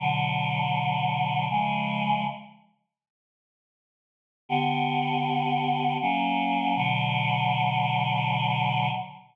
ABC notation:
X:1
M:3/4
L:1/8
Q:1/4=80
K:Bm
V:1 name="Choir Aahs"
[B,,D,F,]4 [C,^E,^G,]2 | z6 | [D,B,G]4 [F,^A,C]2 | [B,,D,F,]6 |]